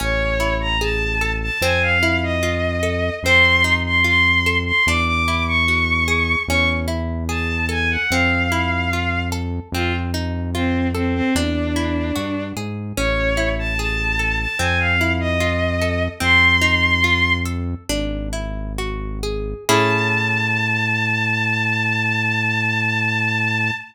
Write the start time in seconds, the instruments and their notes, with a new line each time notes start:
0.00 synth bass 1 A1, acoustic guitar (steel) C#4, violin C#5
0.40 acoustic guitar (steel) E4
0.60 violin A#5
0.81 acoustic guitar (steel) G#4, violin A5
1.21 acoustic guitar (steel) A4
1.42 violin A5
1.61 synth bass 1 F2, acoustic guitar (steel) C4, violin G#5
1.82 violin F5
2.03 acoustic guitar (steel) E4
2.23 violin D#5
2.43 acoustic guitar (steel) F4
2.83 acoustic guitar (steel) A4
3.23 synth bass 1 F2, acoustic guitar (steel) C4, violin C6
3.64 acoustic guitar (steel) D#4
3.86 violin C6
4.04 acoustic guitar (steel) F4, violin C6
4.46 acoustic guitar (steel) A4
4.66 violin C6
4.86 synth bass 1 E2, acoustic guitar (steel) D4, violin D6
5.07 violin D6
5.28 acoustic guitar (steel) E4
5.47 violin C#6
5.68 acoustic guitar (steel) F#4
6.08 acoustic guitar (steel) G#4
6.48 synth bass 1 E2, acoustic guitar (steel) C#4, violin C#6
6.88 acoustic guitar (steel) E4
7.29 acoustic guitar (steel) G#4, violin A5
7.69 acoustic guitar (steel) A4, violin G#5
7.90 violin F#5
8.11 synth bass 1 F2, acoustic guitar (steel) C4, violin F5
8.52 acoustic guitar (steel) E4
8.93 acoustic guitar (steel) F4
9.32 acoustic guitar (steel) A4
9.72 synth bass 1 F2, acoustic guitar (steel) C4, violin F4
10.14 acoustic guitar (steel) D#4
10.54 violin C4, acoustic guitar (steel) F4
10.94 violin C4, acoustic guitar (steel) A4
11.14 violin C4
11.35 synth bass 1 E2, violin D4, acoustic guitar (steel) D4
11.76 acoustic guitar (steel) E4
12.16 synth bass 1 G2, acoustic guitar (steel) F#4
12.56 synth bass 1 G#2, acoustic guitar (steel) G#4
12.97 synth bass 1 A1, acoustic guitar (steel) C#4, violin C#5
13.37 acoustic guitar (steel) E4
13.59 violin A5
13.78 acoustic guitar (steel) G#4, violin A5
14.19 acoustic guitar (steel) A4
14.39 violin A5
14.59 synth bass 1 F2, acoustic guitar (steel) C4, violin G#5
14.79 violin F5
15.01 acoustic guitar (steel) E4
15.20 violin D#5
15.40 acoustic guitar (steel) F4
15.82 acoustic guitar (steel) A4
16.20 synth bass 1 F2, acoustic guitar (steel) C4, violin C6
16.61 acoustic guitar (steel) D#4
17.04 acoustic guitar (steel) F4
17.45 acoustic guitar (steel) A4
17.89 synth bass 1 G#1, acoustic guitar (steel) D4
18.33 acoustic guitar (steel) E4
18.78 acoustic guitar (steel) F#4
19.23 acoustic guitar (steel) G#4
19.69 synth bass 1 A2, acoustic guitar (steel) C#4 E4 G#4 A4, violin A5